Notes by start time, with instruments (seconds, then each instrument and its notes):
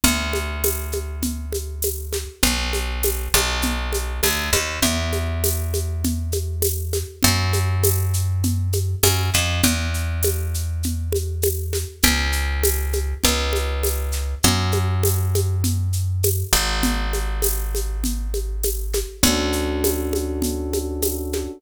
0.04 electric bass (finger) D2, low conga, shaker
0.33 high conga, shaker
0.64 tambourine, high conga, shaker
0.92 high conga, shaker
1.22 low conga, shaker
1.53 high conga, shaker
1.82 tambourine, high conga, shaker
2.13 snare, high conga, shaker
2.43 electric bass (finger) B1, low conga, shaker
2.73 high conga, shaker
3.03 tambourine, high conga, shaker
3.34 electric bass (finger) B1, high conga, shaker
3.62 low conga, shaker
3.93 high conga, shaker
4.23 electric bass (finger) D2, tambourine, high conga, shaker
4.53 electric bass (finger) D#2, snare, high conga, shaker
4.82 electric bass (finger) E2, low conga, shaker
5.12 high conga, shaker
5.44 tambourine, high conga, shaker
5.74 high conga, shaker
6.04 low conga, shaker
6.32 high conga, shaker
6.62 tambourine, high conga, shaker
6.93 snare, high conga, shaker
7.23 electric bass (finger) F#2, low conga, shaker
7.53 high conga, shaker
7.83 tambourine, high conga, shaker
8.13 shaker
8.43 low conga, shaker
8.73 high conga, shaker
9.03 electric bass (finger) F#2, tambourine, high conga, shaker
9.34 electric bass (finger) F2, snare, shaker
9.63 electric bass (finger) E2, low conga, shaker
9.94 shaker
10.23 tambourine, high conga, shaker
10.54 shaker
10.83 low conga, shaker
11.12 high conga, shaker
11.42 tambourine, high conga, shaker
11.73 snare, high conga, shaker
12.03 electric bass (finger) C#2, low conga, shaker
12.32 shaker
12.63 tambourine, high conga, shaker
12.93 high conga, shaker
13.24 electric bass (finger) C#2, low conga, shaker
13.53 high conga, shaker
13.83 tambourine, high conga, shaker
14.12 snare, shaker
14.43 electric bass (finger) F#2, low conga, shaker
14.72 high conga, shaker
15.03 tambourine, high conga, shaker
15.35 high conga, shaker
15.64 low conga, shaker
15.93 shaker
16.23 tambourine, high conga, shaker
16.53 electric bass (finger) G#1, snare, shaker
16.83 low conga, shaker
17.13 high conga, shaker
17.42 tambourine, high conga, shaker
17.75 high conga, shaker
18.04 low conga, shaker
18.34 high conga, shaker
18.63 tambourine, high conga, shaker
18.93 snare, high conga, shaker
19.23 electric bass (finger) D2, electric piano 1 C#4 D4 F#4 A4, low conga, shaker
19.53 shaker
19.84 tambourine, high conga, shaker
20.13 high conga, shaker
20.42 low conga, shaker
20.73 high conga, shaker
21.02 tambourine, high conga, shaker
21.33 snare, high conga, shaker